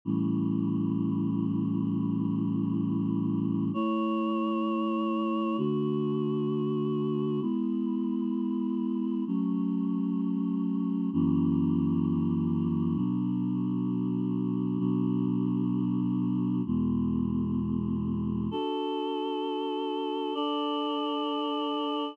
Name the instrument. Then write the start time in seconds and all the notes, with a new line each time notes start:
choir aahs
0.05 A2 E3 G3 C#4
3.74 A3 E4 C#5
5.58 D3 A3 F#4
7.41 G#3 B3 E4
9.27 F#3 A3 C#4
11.13 F#2 E3 A#3 C#4
12.96 B2 F#3 D4
14.79 B2 F#3 D4
16.66 E2 B2 G#3
18.51 D4 F#4 A4
20.34 D4 A4 D5